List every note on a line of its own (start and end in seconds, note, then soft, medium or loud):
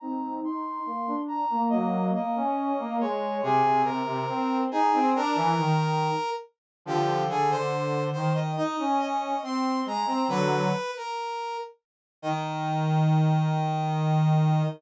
0.00 0.39 C4 medium
0.00 0.39 D#4 loud
0.00 0.34 A#5 loud
0.43 0.79 D#4 medium
0.43 1.16 C6 loud
0.86 1.07 A#3 medium
1.07 1.45 D4 medium
1.28 1.62 A#5 loud
1.50 1.68 A#3 medium
1.69 2.09 F#3 medium
1.69 2.09 A#3 medium
1.69 2.05 D#5 loud
2.14 2.35 A#3 medium
2.14 2.96 D#5 loud
2.36 2.72 C#4 medium
2.79 2.97 A#3 medium
3.00 3.41 G#3 medium
3.00 3.37 C#5 loud
3.43 3.62 C3 loud
3.43 3.82 G#4 loud
3.65 3.84 C3 medium
3.84 4.02 C3 medium
3.84 4.58 A#4 medium
4.06 4.25 C3 medium
4.28 4.65 C4 medium
4.71 4.92 D#4 medium
4.71 5.09 G#4 loud
4.94 5.14 C4 medium
5.16 5.36 D4 medium
5.16 6.30 A#4 loud
5.35 5.54 E3 medium
5.58 6.10 D#3 medium
6.85 7.26 D3 medium
6.85 7.26 F3 medium
6.85 7.24 G4 loud
7.28 7.49 D3 medium
7.28 7.50 G#4 loud
7.50 8.10 D3 medium
7.50 8.04 C5 loud
8.13 8.56 D#3 medium
8.13 8.33 C5 medium
8.34 8.52 D#5 medium
8.57 8.76 D#4 medium
8.57 8.98 D#5 loud
8.79 9.33 C#4 medium
9.00 9.37 D#5 medium
9.42 9.82 C4 medium
9.42 9.80 C6 medium
9.86 10.05 G#3 medium
9.86 10.07 A#5 medium
10.06 10.24 C4 medium
10.06 10.28 A#5 medium
10.28 10.67 D3 medium
10.28 10.67 F#3 medium
10.28 10.91 B4 loud
10.97 11.57 A#4 medium
12.22 14.62 D#3 loud
12.22 14.62 D#5 loud